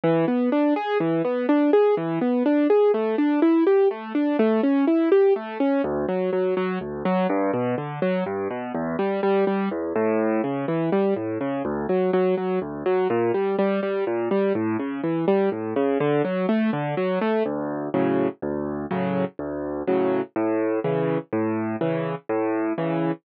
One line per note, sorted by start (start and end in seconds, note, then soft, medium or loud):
0.04 0.25 E3 loud
0.28 0.49 B3 medium
0.52 0.74 D4 medium
0.76 0.98 G#4 medium
1.00 1.22 E3 medium
1.24 1.46 B3 medium
1.49 1.70 D4 medium
1.73 1.95 G#4 medium
1.97 2.19 E3 medium
2.21 2.43 B3 medium
2.45 2.67 D4 medium
2.70 2.92 G#4 medium
2.94 3.16 A3 medium
3.18 3.40 D4 medium
3.42 3.64 E4 medium
3.67 3.88 G4 medium
3.91 4.13 A3 medium
4.15 4.36 D4 medium
4.39 4.61 A3 loud
4.63 4.85 C#4 medium
4.87 5.09 E4 medium
5.12 5.33 G4 medium
5.36 5.58 A3 medium
5.60 5.82 C#4 medium
5.84 6.06 D2 loud
6.08 6.30 F#3 medium
6.33 6.54 F#3 medium
6.57 6.79 F#3 medium
6.81 7.03 D2 medium
7.05 7.27 F#3 loud
7.29 7.51 G2 loud
7.53 7.75 B2 loud
7.78 7.99 D3 medium
8.02 8.24 F#3 medium
8.26 8.48 G2 loud
8.50 8.72 B2 medium
8.74 8.96 E2 loud
8.99 9.20 G3 medium
9.23 9.45 G3 loud
9.47 9.69 G3 medium
9.71 9.93 E2 medium
9.95 10.42 A2 loud
10.44 10.66 C#3 medium
10.68 10.90 E3 medium
10.92 11.14 G3 medium
11.16 11.38 A2 medium
11.41 11.62 C#3 medium
11.65 11.86 D2 loud
11.89 12.11 F#3 medium
12.13 12.35 F#3 loud
12.37 12.59 F#3 medium
12.62 12.83 D2 medium
12.86 13.07 F#3 medium
13.10 13.32 A#2 loud
13.34 13.56 G3 medium
13.58 13.80 G3 medium
13.83 14.04 G3 medium
14.07 14.29 A#2 medium
14.31 14.53 G3 medium
14.55 14.77 A2 loud
14.79 15.01 C#3 medium
15.03 15.25 E3 medium
15.28 15.49 G3 medium
15.52 15.74 A2 medium
15.76 15.98 C#3 loud
16.00 16.22 D3 loud
16.24 16.46 F#3 medium
16.49 16.70 A3 medium
16.73 16.95 D3 loud
16.97 17.19 F#3 medium
17.21 17.43 A3 medium
17.45 17.89 D2 loud
17.94 18.28 A2 medium
17.94 18.28 C#3 medium
17.94 18.28 F#3 medium
18.42 18.86 D2 loud
18.91 19.24 A2 medium
18.91 19.24 C#3 medium
18.91 19.24 F#3 medium
19.39 19.83 D2 loud
19.87 20.21 A2 medium
19.87 20.21 C#3 medium
19.87 20.21 F#3 medium
20.36 20.79 A2 loud
20.84 21.18 C#3 medium
20.84 21.18 E3 medium
21.33 21.76 A2 loud
21.81 22.15 C#3 medium
21.81 22.15 E3 medium
22.29 22.73 A2 loud
22.78 23.12 C#3 medium
22.78 23.12 E3 medium